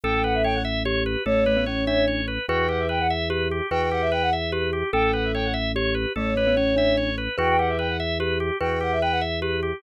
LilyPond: <<
  \new Staff \with { instrumentName = "Flute" } { \time 6/8 \key e \dorian \tempo 4. = 98 g''16 g''16 fis''16 e''16 g''16 fis''16 r4. | cis''2. | g''16 g''16 fis''16 e''16 g''16 fis''16 r4. | g''16 g''16 fis''16 e''16 g''16 fis''16 r4. |
g''16 g''16 fis''16 e''16 g''16 fis''16 r4. | cis''2. | g''16 g''16 fis''16 e''16 g''16 fis''16 r4. | g''16 g''16 fis''16 e''16 g''16 fis''16 r4. | }
  \new Staff \with { instrumentName = "Glockenspiel" } { \time 6/8 \key e \dorian a'4. r8 g'4 | a8 a16 b16 cis'8 d'4 r8 | b'4. r8 g'4 | b'4. r8 g'4 |
a'4. r8 g'4 | a8 a16 b16 cis'8 d'4 r8 | b'4. r8 g'4 | b'4. r8 g'4 | }
  \new Staff \with { instrumentName = "Drawbar Organ" } { \time 6/8 \key e \dorian a'8 b'8 cis''8 e''8 cis''8 b'8 | a'8 b'8 cis''8 e''8 cis''8 b'8 | fis'8 g'8 b'8 e''8 b'8 g'8 | fis'8 g'8 b'8 e''8 b'8 g'8 |
a'8 b'8 cis''8 e''8 cis''8 b'8 | a'8 b'8 cis''8 e''8 cis''8 b'8 | fis'8 g'8 b'8 e''8 b'8 g'8 | fis'8 g'8 b'8 e''8 b'8 g'8 | }
  \new Staff \with { instrumentName = "Drawbar Organ" } { \clef bass \time 6/8 \key e \dorian a,,2. | a,,2. | e,2. | e,2. |
a,,2. | a,,2. | e,2. | e,2. | }
>>